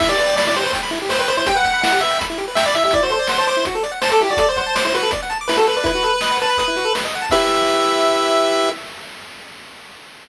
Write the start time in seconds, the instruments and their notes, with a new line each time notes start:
0.00 lead 1 (square) E4 E5, kick, crash
0.09 lead 1 (square) G4 D5
0.18 lead 1 (square) B4 D5, closed hi-hat
0.27 lead 1 (square) G5
0.36 lead 1 (square) D5 B5, snare
0.47 lead 1 (square) E4 D5
0.54 lead 1 (square) G4 C5, closed hi-hat
0.63 lead 1 (square) B4
0.73 lead 1 (square) G5, kick, closed hi-hat
0.83 lead 1 (square) B5
0.91 lead 1 (square) E4, closed hi-hat
1.02 lead 1 (square) G4
1.09 lead 1 (square) B4 C5, snare
1.19 lead 1 (square) B4 G5
1.28 lead 1 (square) C5 B5, closed hi-hat
1.37 lead 1 (square) E4 C5
1.46 lead 1 (square) G4 G5, kick, closed hi-hat
1.55 lead 1 (square) B4 F#5
1.64 lead 1 (square) F#5 G5, kick, closed hi-hat
1.73 lead 1 (square) B5
1.82 lead 1 (square) E4 F#5, snare
1.91 lead 1 (square) G4 F#5
2.01 lead 1 (square) B4 E5, closed hi-hat
2.11 lead 1 (square) G5
2.19 lead 1 (square) B5, kick, closed hi-hat
2.30 lead 1 (square) E4
2.38 lead 1 (square) G4, closed hi-hat
2.48 lead 1 (square) B4
2.55 lead 1 (square) E5 G5, snare
2.66 lead 1 (square) D5 B5
2.74 lead 1 (square) E4 E5, closed hi-hat
2.84 lead 1 (square) G4 E5
2.91 lead 1 (square) E4 D5, kick, closed hi-hat
3.03 lead 1 (square) F#4 C5
3.09 lead 1 (square) A4 C5, closed hi-hat
3.19 lead 1 (square) D5
3.27 lead 1 (square) C5 F#5, snare
3.38 lead 1 (square) C5 A5
3.47 lead 1 (square) C5 D6, closed hi-hat
3.57 lead 1 (square) E4
3.65 lead 1 (square) F#4, kick, closed hi-hat
3.75 lead 1 (square) A4
3.83 lead 1 (square) D5, closed hi-hat
3.92 lead 1 (square) F#5
4.02 lead 1 (square) C5 A5, snare
4.12 lead 1 (square) A4 D6
4.19 lead 1 (square) E4 G4, closed hi-hat
4.29 lead 1 (square) F#4 D5
4.37 lead 1 (square) A4 D5, kick, closed hi-hat
4.49 lead 1 (square) C5 D5
4.56 lead 1 (square) C5 F#5, kick, closed hi-hat
4.66 lead 1 (square) A5
4.75 lead 1 (square) C5 D6, snare
4.85 lead 1 (square) E4 C5
4.94 lead 1 (square) F#4 B4, closed hi-hat
5.03 lead 1 (square) A4
5.11 lead 1 (square) D5, kick, closed hi-hat
5.23 lead 1 (square) F#5
5.30 lead 1 (square) A5, closed hi-hat
5.41 lead 1 (square) D6
5.48 lead 1 (square) E4 B4, snare
5.57 lead 1 (square) F#4 A4
5.67 lead 1 (square) A4 B4, closed hi-hat
5.77 lead 1 (square) B4 D5
5.84 lead 1 (square) E4 B4, kick, closed hi-hat
5.95 lead 1 (square) F#4
6.03 lead 1 (square) A4, closed hi-hat
6.14 lead 1 (square) B4
6.21 lead 1 (square) D#5, snare
6.31 lead 1 (square) F#5
6.40 lead 1 (square) B4 A5, closed hi-hat
6.49 lead 1 (square) B5
6.57 lead 1 (square) B4 D#6, kick, closed hi-hat
6.68 lead 1 (square) E4
6.77 lead 1 (square) F#4, closed hi-hat
6.85 lead 1 (square) A4
6.95 lead 1 (square) B4, snare
7.05 lead 1 (square) D#5
7.13 lead 1 (square) F#5, closed hi-hat
7.22 lead 1 (square) A5
7.30 lead 1 (square) E4 G4 B4 E5, kick, crash